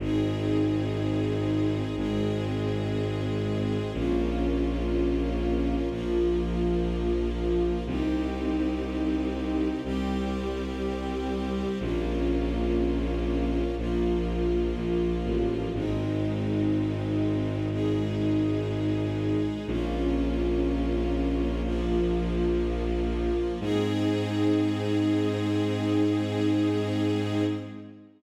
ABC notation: X:1
M:4/4
L:1/8
Q:1/4=61
K:Ab
V:1 name="String Ensemble 1"
[CEA]4 [A,CA]4 | [B,DF]4 [F,B,F]4 | [CEG]4 [G,CG]4 | [B,DF]4 [F,B,F]4 |
[A,CE]4 [A,EA]4 | [B,DF]4 [F,B,F]4 | [CEA]8 |]
V:2 name="Violin" clef=bass
A,,,4 A,,,4 | B,,,4 B,,,4 | C,,4 C,,4 | B,,,4 B,,,2 B,,, =A,,, |
A,,,8 | B,,,8 | A,,8 |]